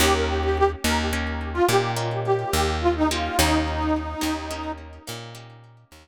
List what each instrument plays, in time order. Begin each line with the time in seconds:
0.00 electric bass (finger) D#2, acoustic guitar (steel) A#3 C#4 D#4 G4, harmonica G4
0.14 harmonica A#4
0.27 harmonica G4
0.43 harmonica G4
0.57 harmonica G4
0.84 electric bass (finger) D#2, acoustic guitar (steel) A#3 C#4 D#4 G4, harmonica A#4
1.13 acoustic guitar (steel) A#3 C#4 D#4 G4
1.53 harmonica F4
1.68 electric bass (finger) A#2, acoustic guitar (steel) A#3 C#4 D#4 G4, harmonica G4
1.96 acoustic guitar (steel) A#3 C#4 D#4 G4
2.25 harmonica G4
2.53 electric bass (finger) D#2
2.81 harmonica F4
2.95 harmonica D#4
3.10 acoustic guitar (steel) A#3 C#4 D#4 G4, harmonica F4
3.37 electric bass (finger) D#2, acoustic guitar (steel) A#3 C#4 D#4 G4, harmonica D#4
4.21 electric bass (finger) D#2, acoustic guitar (steel) A#3 C#4 D#4 G4
4.51 acoustic guitar (steel) A#3 C#4 D#4 G4
5.07 electric bass (finger) A#2, acoustic guitar (steel) A#3 C#4 D#4 G4
5.35 acoustic guitar (steel) A#3 C#4 D#4 G4
5.92 electric bass (finger) D#2